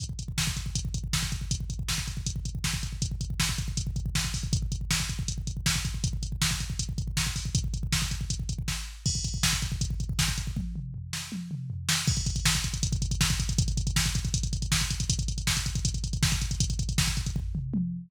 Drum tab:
CC |----------------|----------------|----------------|----------------|
HH |x-x---x-x-x---x-|x-x---x-x-x---x-|x-x---x-x-x---o-|x-x---x-x-x---x-|
SD |----o-------o---|----o-------o---|----o-------o---|----o-------o---|
T1 |----------------|----------------|----------------|----------------|
T2 |----------------|----------------|----------------|----------------|
FT |----------------|----------------|----------------|----------------|
BD |oooooooooooooooo|oooooooooooooooo|oooooooooooooooo|oooooooooooooooo|

CC |----------------|----------------|x---------------|----------------|
HH |x-x---x-x-x---o-|x-x---x-x-x-----|--x---x-x-x---x-|----------------|
SD |----o-------o---|----o-------o---|----o-------o---|------o-------o-|
T1 |----------------|----------------|----------------|o-------o-------|
T2 |----------------|----------------|----------------|--o-------o-----|
FT |----------------|----------------|----------------|----o-------o---|
BD |oooooooooooooooo|ooooooooooooo---|oooooooooooooooo|o---------------|

CC |x---------------|----------------|----------------|----------------|
HH |-xxx-xxxxxxx-xxx|xxxx-xxxxxxx-xxx|xxxx-xxxxxxx-xxx|xxxx-xxx--------|
SD |----o-------o---|----o-------o---|----o-------o---|----o-----------|
T1 |----------------|----------------|----------------|------------o---|
T2 |----------------|----------------|----------------|----------o-----|
FT |----------------|----------------|----------------|--------o-------|
BD |oooooooooooooooo|oooooooooooooooo|oooooooooooooooo|ooooooooo-------|